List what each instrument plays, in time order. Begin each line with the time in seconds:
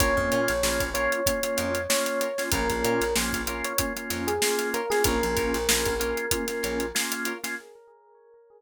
0.00 electric bass (finger) A#1, drawbar organ A#3 C#4 F4, acoustic guitar (steel) F4 A#4 C#5, electric piano 1 C#5, kick, closed hi-hat
0.17 electric bass (finger) F2, kick
0.32 electric bass (finger) A#2, acoustic guitar (steel) F4 A#4 C#5, closed hi-hat
0.48 electric bass (finger) A#1, snare, closed hi-hat
0.63 electric bass (finger) A#1, drawbar organ A#3 C#4 F4, snare
0.80 electric bass (finger) A#1, kick, closed hi-hat
0.94 drawbar organ A#3 C#4 F4, acoustic guitar (steel) F4 A#4 C#5, electric piano 1 C#5, closed hi-hat
1.12 closed hi-hat
1.26 drawbar organ A#3 C#4 F4, kick, closed hi-hat
1.43 drawbar organ A#3 C#4 F4, closed hi-hat
1.57 electric bass (finger) F2, acoustic guitar (steel) F4 A#4 C#5, closed hi-hat
1.75 closed hi-hat
1.89 drawbar organ A#3 C#4 F4, electric piano 1 C#5, snare
2.06 closed hi-hat
2.21 acoustic guitar (steel) F4 A#4 C#5, closed hi-hat
2.38 drawbar organ A#3 C#4 F4, snare, closed hi-hat
2.52 electric bass (finger) A#1, drawbar organ A#3 C#4 F4, acoustic guitar (steel) F4 A#4 C#5, electric piano 1 A#4, kick, closed hi-hat
2.70 electric bass (finger) A#1, kick, closed hi-hat
2.84 electric bass (finger) A#2, acoustic guitar (steel) F4 A#4 C#5, closed hi-hat
3.01 electric bass (finger) A#1, closed hi-hat
3.16 electric bass (finger) A#1, drawbar organ A#3 C#4 F4, snare
3.33 electric bass (finger) A#1, kick, closed hi-hat
3.47 drawbar organ A#3 C#4 F4, acoustic guitar (steel) F4 A#4 C#5, closed hi-hat
3.64 electric piano 1 C#5, closed hi-hat
3.78 drawbar organ A#3 C#4 F4, kick, closed hi-hat
3.96 drawbar organ A#3 C#4 F4, closed hi-hat
4.10 electric bass (finger) F2, acoustic guitar (steel) F4 A#4 C#5, snare, closed hi-hat
4.27 electric piano 1 G#4, closed hi-hat
4.42 drawbar organ A#3 C#4 F4, snare
4.59 snare, closed hi-hat
4.74 acoustic guitar (steel) F4 A#4 C#5, electric piano 1 A#4, closed hi-hat
4.90 drawbar organ A#3 C#4 F4, electric piano 1 G#4, snare, closed hi-hat
5.04 electric bass (finger) A#1, drawbar organ A#3 C#4 F4, acoustic guitar (steel) F4 A#4 C#5, electric piano 1 A#4, kick, closed hi-hat
5.23 electric bass (finger) A#1, closed hi-hat
5.36 electric bass (finger) A#1, acoustic guitar (steel) F4 A#4 C#5, kick, closed hi-hat
5.54 electric bass (finger) A#1, snare, closed hi-hat
5.69 electric bass (finger) A#1, drawbar organ A#3 C#4 F4, snare
5.85 electric bass (finger) A#1, kick, snare, closed hi-hat
5.99 drawbar organ A#3 C#4 F4, acoustic guitar (steel) F4 A#4 C#5, closed hi-hat
6.17 closed hi-hat
6.31 drawbar organ A#3 C#4 F4, kick, closed hi-hat
6.48 drawbar organ A#3 C#4 F4, snare, closed hi-hat
6.63 electric bass (finger) A#1, acoustic guitar (steel) F4 A#4 C#5, closed hi-hat
6.80 closed hi-hat
6.95 drawbar organ A#3 C#4 F4, snare
7.12 closed hi-hat
7.25 acoustic guitar (steel) F4 A#4 C#5, closed hi-hat
7.44 drawbar organ A#3 C#4 F4, snare, closed hi-hat